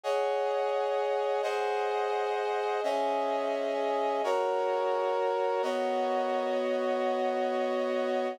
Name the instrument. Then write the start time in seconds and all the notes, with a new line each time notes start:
brass section
0.03 G#4 C#5 D#5 F#5
1.43 G#4 C5 D#5 F#5
2.83 C#4 G#4 D#5 E5
4.24 F#4 A#4 C#5
5.62 B3 F#4 C#5 D#5